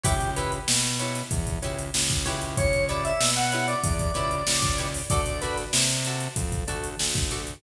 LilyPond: <<
  \new Staff \with { instrumentName = "Drawbar Organ" } { \time 4/4 \key b \minor \tempo 4 = 95 g'8 b'16 r2. r16 | cis''8 d''16 e''8 fis''8 d''2~ d''16 | d''8 b'16 r2. r16 | }
  \new Staff \with { instrumentName = "Acoustic Guitar (steel)" } { \time 4/4 \key b \minor <e' g' b' cis''>8 <e' g' b' cis''>4 <e' g' b' cis''>4 <e' g' b' cis''>4 <e' g' b' cis''>8~ | <e' g' b' cis''>8 <e' g' b' cis''>4 <e' g' b' cis''>4 <e' g' b' cis''>4 <e' g' b' cis''>8 | <fis' a' d''>8 <fis' a' d''>4 <fis' a' d''>4 <fis' a' d''>4 <fis' a' d''>8 | }
  \new Staff \with { instrumentName = "Synth Bass 1" } { \clef bass \time 4/4 \key b \minor cis,4 b,4 e,8 cis,8 cis,8 cis,8~ | cis,4 b,4 e,8 cis,8 cis,4 | d,4 c4 f,8 d,8 d,4 | }
  \new DrumStaff \with { instrumentName = "Drums" } \drummode { \time 4/4 <hh bd>16 hh16 hh16 hh16 sn16 <hh sn>16 hh16 <hh sn>16 <hh bd>16 <hh bd>16 hh16 hh16 sn16 <hh bd sn>16 <hh sn>16 hh16 | <hh bd>16 hh16 hh16 hh16 sn16 hh16 hh16 hh16 <hh bd>16 <hh bd>16 hh16 hh16 sn16 <hh bd sn>16 hh16 hho16 | <hh bd>16 hh16 <hh sn>16 <hh sn>16 sn16 hh16 hh16 hh16 <hh bd>16 <hh bd>16 hh16 hh16 sn16 <hh bd sn>16 hh16 hh16 | }
>>